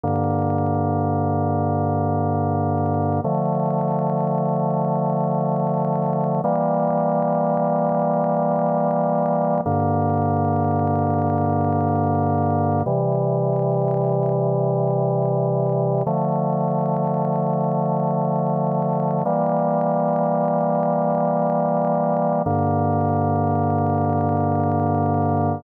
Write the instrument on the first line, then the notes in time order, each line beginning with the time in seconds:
drawbar organ
0.04 G2 D3 A#3
3.24 D3 F3 A3
6.44 E3 G3 A#3
9.66 G2 D3 A#3
12.86 C3 E3 G3
16.07 D3 F3 A3
19.25 E3 G3 A#3
22.46 G2 D3 A#3